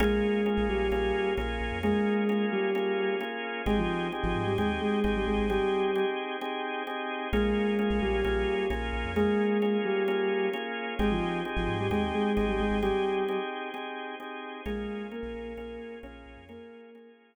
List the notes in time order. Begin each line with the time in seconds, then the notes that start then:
0.00 A#1 G#3 A#3 C#4 F4 G#4
0.46 A#3 C#4 F4 G#4
0.57 A#1
0.69 A#1 G3 G4
0.91 A#1 A#3 C#4 F4 G#4
1.37 A#1 A#3 C#4 F4 G#4
1.61 A#1
1.72 F2
1.83 G#3 A#3 C#4 F4 G#4
2.29 A#3 C#4 F4 G#4
2.52 G3 G4
2.75 A#3 C#4 F4 G#4
3.21 A#3 C#4 F4 G#4
3.66 G#1 G#3 C4 D#4 G4 G#4
3.78 F3 F4
4.12 C4 D#4 G4 G#4
4.23 G#1 F3 F4
4.35 G#2
4.47 G3 G4
4.58 D#2 G#3 C4 D#4 G4 G#4
4.81 G#3 G#4
5.04 G#1 C4 D#4 G4 G#4
5.15 G3 G4
5.27 G#1 G#3 G#4
5.38 G#1
5.50 G3 C4 D#4 G4 G#4
5.96 C4 D#4 G4 G#4
6.41 C4 D#4 G4 G#4
6.87 C4 D#4 G4 G#4
7.33 A#1 G#3 A#3 C#4 F4 G#4
7.79 A#3 C#4 F4 G#4
7.90 A#1
8.01 A#1 G3 G4
8.24 A#1 A#3 C#4 F4 G#4
8.70 A#1 A#3 C#4 F4 G#4
8.93 A#1
9.05 F2
9.16 G#3 A#3 C#4 F4 G#4
9.62 A#3 C#4 F4 G#4
9.85 G3 G4
10.08 A#3 C#4 F4 G#4
10.53 A#3 C#4 F4 G#4
10.99 G#1 G#3 C4 D#4 G4 G#4
11.11 F3 F4
11.45 C4 D#4 G4 G#4
11.56 G#1 F3 F4
11.68 G#2
11.79 G3 G4
11.91 D#2 G#3 C4 D#4 G4 G#4
12.14 G#3 G#4
12.37 G#1 C4 D#4 G4 G#4
12.48 G3 G4
12.59 G#1 G#3 G#4
12.71 G#1
12.82 G3 C4 D#4 G4 G#4
13.28 C4 D#4 G4 G#4
13.74 C4 D#4 G4 G#4
14.20 C4 D#4 G4 G#4
14.66 A#1 G#3 A#3 C#4 F4 G#4
15.11 A#3 C#4 F4 G#4 A#4
15.23 A#1
15.34 A#1
15.57 A#1 A#3 C#4 F4 G#4
16.03 A#1 A#3 C#4 F4 G#4 C#5
16.26 A#1
16.37 F2
16.49 A#3 C#4 F4 G#4 A#4
16.95 A#3 C#4 F4 G#4